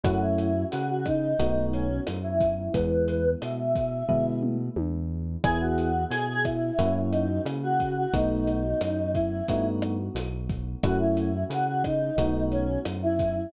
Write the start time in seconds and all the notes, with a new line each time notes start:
0.04 F#2 A3 C#4 E4 F#4, kick, cross-stick, closed hi-hat
0.21 E4
0.38 closed hi-hat
0.71 C#3 F#4, closed hi-hat
0.89 F#4
1.06 D#4, kick, cross-stick, closed hi-hat
1.39 B1 A3 B3 D#4 F#4, kick, closed hi-hat
1.73 C#4, closed hi-hat
2.07 F#2, cross-stick, closed hi-hat
2.23 E4
2.40 kick, closed hi-hat
2.57 E4
2.73 E2 G#3 B3 E4 B4, kick, closed hi-hat
3.08 closed hi-hat
3.40 B2 E5, cross-stick, closed hi-hat
3.75 kick, closed hi-hat
4.09 B2 G#3 B3 E4, kick, floor tom
4.43 mid tom
4.76 E2, high tom
5.44 E2 B3 E4 G#4, kick, cross-stick, closed hi-hat
5.61 F#4
5.78 closed hi-hat
6.10 B2 G#4, closed hi-hat
6.29 G#4
6.44 E4, kick, cross-stick, closed hi-hat
6.79 F#2 A#3 C#4 E4 F#4, kick, closed hi-hat
7.11 D#4, closed hi-hat
7.45 C#3, cross-stick, closed hi-hat
7.62 F#4
7.80 kick, closed hi-hat
7.97 F#4
8.13 B1 A3 B3 D#4 F#4, kick, closed hi-hat
8.47 closed hi-hat
8.81 F#2, cross-stick, closed hi-hat
9.14 E4, kick, closed hi-hat
9.48 G2 A3 B3 D#4 F#4, kick, closed hi-hat
9.82 cross-stick, closed hi-hat
10.15 B1, closed hi-hat
10.49 kick, closed hi-hat
10.83 F#2 A3 C#4 E4 F#4, kick, cross-stick, closed hi-hat
11.00 E4
11.17 closed hi-hat
11.50 C#3 F#4, closed hi-hat
11.67 F#4
11.84 D#4, kick, cross-stick, closed hi-hat
12.17 B1 A3 B3 D#4 F#4, kick, closed hi-hat
12.51 C#4, closed hi-hat
12.85 F#2, cross-stick, closed hi-hat
13.03 E4
13.19 kick, closed hi-hat
13.35 E4